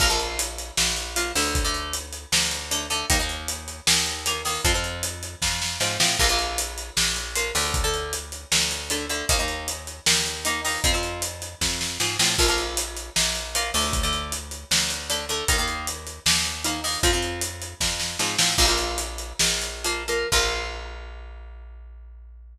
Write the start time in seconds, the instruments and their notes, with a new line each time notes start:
0.00 electric bass (finger) A#1, acoustic guitar (steel) F3 A#3, kick, crash
0.10 acoustic guitar (steel) F3 A#3
0.20 closed hi-hat
0.39 closed hi-hat
0.58 closed hi-hat
0.77 electric bass (finger) A#1, snare
0.97 closed hi-hat
1.16 acoustic guitar (steel) F3 A#3, closed hi-hat
1.35 electric bass (finger) D2, acoustic guitar (steel) D3 A3, open hi-hat
1.55 kick, closed hi-hat
1.65 acoustic guitar (steel) D3 A3
1.74 closed hi-hat
1.93 closed hi-hat
2.13 closed hi-hat
2.32 electric bass (finger) D2, snare
2.51 closed hi-hat
2.71 acoustic guitar (steel) D3 A3, closed hi-hat
2.90 acoustic guitar (steel) D3 A3, closed hi-hat
3.10 electric bass (finger) D#2, acoustic guitar (steel) D#3 A#3, kick, closed hi-hat
3.19 acoustic guitar (steel) D#3 A#3
3.29 closed hi-hat
3.48 closed hi-hat
3.68 closed hi-hat
3.87 electric bass (finger) D#2, snare
4.06 closed hi-hat
4.26 acoustic guitar (steel) D#3 A#3, closed hi-hat
4.45 acoustic guitar (steel) D#3 A#3, open hi-hat
4.64 electric bass (finger) F2, acoustic guitar (steel) F3 C4, kick, closed hi-hat
4.74 acoustic guitar (steel) F3 C4
4.84 closed hi-hat
5.03 closed hi-hat
5.23 closed hi-hat
5.42 electric bass (finger) F2, kick, snare
5.62 snare
5.80 electric bass (finger) G#2, acoustic guitar (steel) F3 C4, snare
6.00 electric bass (finger) A2, acoustic guitar (steel) F3 C4, snare
6.19 electric bass (finger) A#1, acoustic guitar (steel) F3 A#3, kick, crash
6.29 acoustic guitar (steel) F3 A#3
6.39 closed hi-hat
6.58 closed hi-hat
6.78 closed hi-hat
6.97 electric bass (finger) A#1, snare
7.16 closed hi-hat
7.35 acoustic guitar (steel) F3 A#3, closed hi-hat
7.55 electric bass (finger) D2, acoustic guitar (steel) D3 A3, open hi-hat
7.74 kick, closed hi-hat
7.84 acoustic guitar (steel) D3 A3
7.94 closed hi-hat
8.13 closed hi-hat
8.32 closed hi-hat
8.52 electric bass (finger) D2, snare
8.71 closed hi-hat
8.90 acoustic guitar (steel) D3 A3, closed hi-hat
9.10 acoustic guitar (steel) D3 A3, closed hi-hat
9.29 electric bass (finger) D#2, acoustic guitar (steel) D#3 A#3, kick, closed hi-hat
9.39 acoustic guitar (steel) D#3 A#3
9.48 closed hi-hat
9.68 closed hi-hat
9.87 closed hi-hat
10.06 electric bass (finger) D#2, snare
10.26 closed hi-hat
10.45 acoustic guitar (steel) D#3 A#3, closed hi-hat
10.65 acoustic guitar (steel) D#3 A#3, open hi-hat
10.84 electric bass (finger) F2, acoustic guitar (steel) F3 C4, kick, closed hi-hat
10.94 acoustic guitar (steel) F3 C4
11.03 closed hi-hat
11.22 closed hi-hat
11.42 closed hi-hat
11.61 electric bass (finger) F2, kick, snare
11.81 snare
12.00 electric bass (finger) G#2, acoustic guitar (steel) F3 C4, snare
12.19 electric bass (finger) A2, acoustic guitar (steel) F3 C4, snare
12.38 electric bass (finger) A#1, acoustic guitar (steel) F3 A#3, kick, crash
12.48 acoustic guitar (steel) F3 A#3
12.58 closed hi-hat
12.77 closed hi-hat
12.97 closed hi-hat
13.16 electric bass (finger) A#1, snare
13.35 closed hi-hat
13.55 acoustic guitar (steel) F3 A#3, closed hi-hat
13.74 electric bass (finger) D2, acoustic guitar (steel) D3 A3, open hi-hat
13.93 kick, closed hi-hat
14.03 acoustic guitar (steel) D3 A3
14.13 closed hi-hat
14.32 closed hi-hat
14.51 closed hi-hat
14.71 electric bass (finger) D2, snare
14.90 closed hi-hat
15.10 acoustic guitar (steel) D3 A3, closed hi-hat
15.29 acoustic guitar (steel) D3 A3, closed hi-hat
15.48 electric bass (finger) D#2, acoustic guitar (steel) D#3 A#3, kick, closed hi-hat
15.58 acoustic guitar (steel) D#3 A#3
15.68 closed hi-hat
15.87 closed hi-hat
16.07 closed hi-hat
16.26 electric bass (finger) D#2, snare
16.45 closed hi-hat
16.64 acoustic guitar (steel) D#3 A#3, closed hi-hat
16.84 acoustic guitar (steel) D#3 A#3, open hi-hat
17.03 electric bass (finger) F2, acoustic guitar (steel) F3 C4, kick, closed hi-hat
17.13 acoustic guitar (steel) F3 C4
17.23 closed hi-hat
17.41 closed hi-hat
17.62 closed hi-hat
17.80 electric bass (finger) F2, kick, snare
18.00 snare
18.19 electric bass (finger) G#2, acoustic guitar (steel) F3 C4, snare
18.38 electric bass (finger) A2, acoustic guitar (steel) F3 C4, snare
18.58 electric bass (finger) A#1, acoustic guitar (steel) F3 A#3, kick, crash
18.68 acoustic guitar (steel) F3 A#3
18.78 closed hi-hat
18.98 closed hi-hat
19.18 closed hi-hat
19.39 electric bass (finger) A#1, snare
19.62 closed hi-hat
19.85 acoustic guitar (steel) F3 A#3, closed hi-hat
20.08 acoustic guitar (steel) F3 A#3, closed hi-hat
20.32 electric bass (finger) A#1, acoustic guitar (steel) F3 A#3, kick, crash